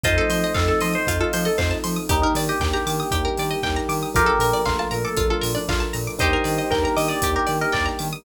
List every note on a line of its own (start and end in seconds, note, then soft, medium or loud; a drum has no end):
0.04 0.18 F2 medium
0.04 1.06 F3 medium
0.04 1.06 A3 medium
0.04 1.06 C4 medium
0.04 0.51 C4 medium
0.04 1.06 D#4 medium
0.04 0.51 D#4 medium
0.04 0.16 F4 medium
0.04 0.51 F4 medium
0.04 0.51 A4 loud
0.04 0.53 C5 loud
0.04 0.53 D#5 loud
0.04 1.78 D#5 loud
0.04 kick loud
0.04 closed hi-hat loud
0.18 0.29 A4 medium
0.30 0.44 F3 medium
0.30 0.42 C5 medium
0.30 open hi-hat medium
0.44 0.55 D#5 medium
0.54 0.70 F2 medium
0.54 1.02 C4 medium
0.54 1.02 D#4 medium
0.54 1.02 F4 medium
0.54 0.67 A4 medium
0.54 1.02 A4 medium
0.54 0.66 F5 medium
0.54 kick medium
0.54 clap loud
0.68 0.80 A4 loud
0.68 0.80 A5 medium
0.81 0.96 F3 medium
0.81 0.93 D#5 medium
0.81 0.93 C6 medium
0.81 open hi-hat medium
0.93 1.18 C5 loud
0.93 1.05 D#6 medium
1.07 1.21 F2 medium
1.07 2.08 F3 medium
1.07 2.08 A3 medium
1.07 1.53 C4 medium
1.07 2.08 D#4 medium
1.07 1.53 D#4 medium
1.07 2.08 F4 medium
1.07 1.53 F4 medium
1.07 1.20 F4 medium
1.07 1.53 A4 medium
1.07 kick loud
1.07 closed hi-hat loud
1.20 1.44 F4 loud
1.20 1.32 A4 medium
1.33 1.48 F3 medium
1.33 1.45 C5 medium
1.33 open hi-hat loud
1.45 1.58 A4 medium
1.45 1.57 D#5 medium
1.58 1.72 F2 medium
1.58 2.06 C4 medium
1.58 2.06 D#4 medium
1.58 2.06 F4 medium
1.58 2.06 A4 medium
1.58 1.70 C5 medium
1.58 1.70 F5 medium
1.58 kick medium
1.58 clap loud
1.71 1.82 A5 medium
1.84 1.99 F3 medium
1.84 1.95 C6 medium
1.84 open hi-hat medium
1.96 2.08 D#6 medium
2.09 2.24 D#2 medium
2.09 3.12 G3 medium
2.09 3.12 A#3 medium
2.09 2.55 D4 medium
2.09 3.12 D4 medium
2.09 2.55 D#4 medium
2.09 3.12 D#4 medium
2.09 2.21 D#4 loud
2.09 2.55 G4 medium
2.09 4.09 G4 medium
2.09 2.21 G4 medium
2.09 2.55 A#4 medium
2.09 kick loud
2.09 closed hi-hat loud
2.22 2.34 D#4 medium
2.22 2.35 A#4 medium
2.35 2.49 D#3 medium
2.35 2.48 D5 medium
2.35 open hi-hat loud
2.49 2.70 G4 medium
2.49 2.60 D#5 medium
2.60 2.74 D#2 medium
2.60 3.07 D4 medium
2.60 3.07 D#4 medium
2.60 3.07 G4 medium
2.60 3.07 A#4 medium
2.60 2.72 G5 medium
2.60 kick medium
2.60 clap loud
2.74 3.56 G4 medium
2.74 2.85 A#5 medium
2.86 3.01 D#3 medium
2.86 2.98 D6 medium
2.86 open hi-hat medium
3.00 3.11 D#6 medium
3.11 3.27 D#2 medium
3.11 4.14 G3 medium
3.11 4.14 A#3 medium
3.11 3.58 D4 medium
3.11 3.58 D#4 medium
3.11 4.14 D#4 medium
3.11 3.23 G4 medium
3.11 3.58 G4 medium
3.11 4.14 G4 medium
3.11 3.58 A#4 medium
3.11 kick loud
3.11 closed hi-hat loud
3.25 3.36 A#4 medium
3.38 3.53 D#3 medium
3.38 3.51 D5 medium
3.38 open hi-hat medium
3.51 3.62 D#5 medium
3.63 3.78 D#2 medium
3.63 4.10 D4 medium
3.63 4.10 D#4 medium
3.63 4.10 G4 medium
3.63 4.10 A#4 medium
3.63 3.75 G5 medium
3.63 kick medium
3.63 clap loud
3.76 3.88 A#5 medium
3.89 4.03 D#3 medium
3.89 4.01 D6 medium
3.89 open hi-hat medium
4.03 4.14 D#6 medium
4.14 4.30 A#1 medium
4.14 5.16 F3 medium
4.14 5.16 A3 medium
4.14 5.16 A#3 medium
4.14 4.60 D4 medium
4.14 5.16 D4 medium
4.14 4.60 F4 medium
4.14 4.27 F4 medium
4.14 4.61 G4 loud
4.14 4.60 A4 medium
4.14 4.60 A#4 medium
4.14 4.88 A#4 medium
4.14 4.61 A#4 loud
4.14 kick loud
4.14 closed hi-hat loud
4.26 4.38 A4 medium
4.39 4.53 A#2 medium
4.39 4.52 A#4 medium
4.39 open hi-hat medium
4.53 4.65 D5 medium
4.65 4.81 A#1 medium
4.65 5.13 D4 medium
4.65 4.78 F4 loud
4.65 5.13 F4 medium
4.65 5.13 A4 medium
4.65 5.13 A#4 medium
4.65 4.77 F5 medium
4.65 kick medium
4.65 clap loud
4.79 4.91 F4 loud
4.79 4.91 A5 medium
4.91 5.06 A#2 medium
4.91 5.04 A#4 medium
4.91 5.02 A#5 medium
4.91 open hi-hat medium
5.04 5.28 A4 loud
5.04 5.16 D6 medium
5.17 5.32 A#1 medium
5.17 6.19 F3 medium
5.17 6.19 A3 medium
5.17 5.63 D4 medium
5.17 6.19 D4 medium
5.17 5.63 F4 medium
5.17 5.29 F4 medium
5.17 6.19 F4 medium
5.17 5.63 A4 medium
5.17 5.63 A#4 medium
5.17 kick loud
5.17 closed hi-hat loud
5.30 5.53 F4 medium
5.30 5.42 A4 medium
5.41 5.57 A#2 medium
5.41 5.53 A#4 medium
5.41 open hi-hat loud
5.55 5.68 D4 loud
5.55 5.66 D5 medium
5.68 5.82 A#1 medium
5.68 6.15 D4 medium
5.68 6.15 F4 medium
5.68 5.81 F4 loud
5.68 6.15 A4 medium
5.68 6.15 A#4 medium
5.68 5.80 F5 medium
5.68 kick loud
5.68 clap loud
5.80 5.92 A5 medium
5.93 6.09 A#2 medium
5.93 6.05 A#5 medium
5.93 open hi-hat medium
6.07 6.19 D6 medium
6.19 6.35 D#2 medium
6.19 7.21 G3 medium
6.19 7.21 A#3 medium
6.19 6.65 D4 medium
6.19 7.21 D4 medium
6.19 6.65 D#4 medium
6.19 7.21 D#4 medium
6.19 6.65 G4 medium
6.19 8.08 G4 loud
6.19 6.33 G4 medium
6.19 6.65 A#4 medium
6.19 6.70 C5 medium
6.19 6.70 D#5 loud
6.19 kick loud
6.19 closed hi-hat loud
6.33 6.45 A#4 medium
6.44 6.59 D#3 medium
6.44 6.56 D5 medium
6.44 open hi-hat medium
6.58 6.70 D#5 medium
6.70 6.85 D#2 medium
6.70 7.18 D4 medium
6.70 7.18 D#4 medium
6.70 7.18 G4 medium
6.70 6.82 A#4 loud
6.70 7.18 A#4 medium
6.70 6.83 G5 medium
6.70 kick medium
6.70 clap loud
6.83 6.95 A#4 loud
6.83 6.96 A#5 medium
6.96 7.11 D#3 medium
6.96 7.09 D#5 loud
6.96 7.08 D6 medium
6.96 open hi-hat medium
7.08 7.31 D5 loud
7.08 7.20 D#6 medium
7.22 7.37 D#2 medium
7.22 8.24 G3 medium
7.22 8.24 A#3 medium
7.22 7.69 D4 medium
7.22 7.69 D#4 medium
7.22 8.24 D#4 medium
7.22 7.69 G4 medium
7.22 8.24 G4 medium
7.22 7.35 G4 medium
7.22 7.69 A#4 medium
7.22 kick medium
7.22 closed hi-hat loud
7.35 7.57 G4 loud
7.35 7.47 A#4 medium
7.47 7.63 D#3 medium
7.47 7.58 D5 medium
7.47 open hi-hat medium
7.61 7.73 A#4 loud
7.61 7.73 D#5 medium
7.72 7.88 D#2 medium
7.72 8.19 D4 medium
7.72 8.19 D#4 medium
7.72 8.19 G4 medium
7.72 8.19 A#4 medium
7.72 7.85 D5 loud
7.72 7.84 G5 medium
7.72 kick medium
7.72 clap loud
7.86 7.97 A#5 medium
7.99 8.14 D#3 medium
7.99 8.10 D6 medium
7.99 open hi-hat medium
8.13 8.24 D#6 medium